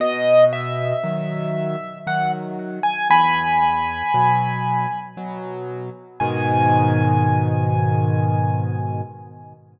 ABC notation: X:1
M:3/4
L:1/16
Q:1/4=58
K:G#m
V:1 name="Acoustic Grand Piano"
d2 e6 f z2 g | [gb]8 z4 | g12 |]
V:2 name="Acoustic Grand Piano" clef=bass
B,,4 [D,F,]4 [D,F,]4 | E,,4 [B,,F,]4 [B,,F,]4 | [G,,B,,D,]12 |]